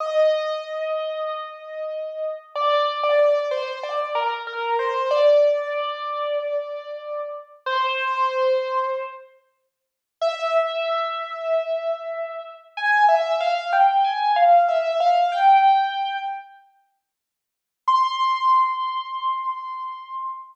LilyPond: \new Staff { \time 4/4 \key c \minor \tempo 4 = 94 ees''1 | d''8. d''16 d''8 c''8 d''8 bes'16 r16 bes'8 c''8 | d''1 | c''2~ c''8 r4. |
\key c \major e''1 | aes''8 e''8 f''8 g''8 aes''8 f''8 e''8 f''8 | g''4. r2 r8 | c'''1 | }